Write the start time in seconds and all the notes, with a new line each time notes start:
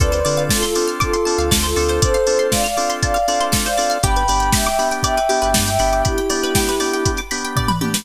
0.00 D2 C4 D4 F4 A4 B4 D5, kick, closed hi-hat
0.12 C5, closed hi-hat
0.25 D3 C4 D4 F4 A4 D5, open hi-hat
0.37 F5, closed hi-hat
0.49 F4 A4 A5, kick, snare
0.63 F4 A4 C6, closed hi-hat
0.75 C4 D4 F4 A4 D6, open hi-hat
0.88 F6, closed hi-hat
1.00 F4 A4 D6, kick, closed hi-hat
1.13 C6, closed hi-hat
1.25 C4 D4 F4 A4 A5, open hi-hat
1.38 D2 F5, closed hi-hat
1.51 D2 D5, kick, snare
1.63 F4 A4 C5, closed hi-hat
1.76 D2 C4 D4 F4 A4, open hi-hat
1.89 C5, closed hi-hat
2.02 A4 C5 D5, kick, closed hi-hat
2.14 F5, closed hi-hat
2.27 C4 D4 F4 A4 A5, open hi-hat
2.39 C6, closed hi-hat
2.51 D5 F5 D6, kick, snare
2.64 D5 F5 F6, closed hi-hat
2.77 C4 D4 F4 A4 D6, open hi-hat
2.90 C6, closed hi-hat
3.02 D5 F5 A5, kick, closed hi-hat
3.14 F5, closed hi-hat
3.28 C4 D4 F4 A4 D5, open hi-hat
3.40 C5, closed hi-hat
3.52 A4, kick, snare
3.65 C5 D5 F5, closed hi-hat
3.78 C4 D4 F4 A4 D5, open hi-hat
3.90 F5, closed hi-hat
4.03 G1 B3 D4 G4 G5 B5, kick, closed hi-hat
4.16 B4, closed hi-hat
4.28 G1 B3 D4 G4 D5, open hi-hat
4.40 G5, closed hi-hat
4.52 E5 G5 B5, kick, snare
4.66 E5 G5 D6, closed hi-hat
4.79 B3 D4 G4 B5, open hi-hat
4.91 G5, closed hi-hat
5.03 D5 E5 G5, kick, closed hi-hat
5.17 B4, closed hi-hat
5.29 B3 D4 G4, open hi-hat
5.42 G1 B4, closed hi-hat
5.54 G2 D5, kick, snare
5.66 E5 G5, closed hi-hat
5.79 G1 B3 D4 G4 B5, open hi-hat
5.93 D6, closed hi-hat
6.05 E4 G4 B5, kick, closed hi-hat
6.18 G5, closed hi-hat
6.30 B3 D4 G4 D5, open hi-hat
6.43 B4, closed hi-hat
6.55 G4, kick, snare
6.69 B4, closed hi-hat
6.80 B3 D4 G4 D5, open hi-hat
6.93 G5, closed hi-hat
7.05 B5, kick, closed hi-hat
7.17 D6, closed hi-hat
7.31 B3 D4 G4 B5, open hi-hat
7.44 G5, closed hi-hat
7.56 D5, kick, floor tom
7.68 B4, mid tom
7.81 B3 D4 G4, high tom
7.94 B4, snare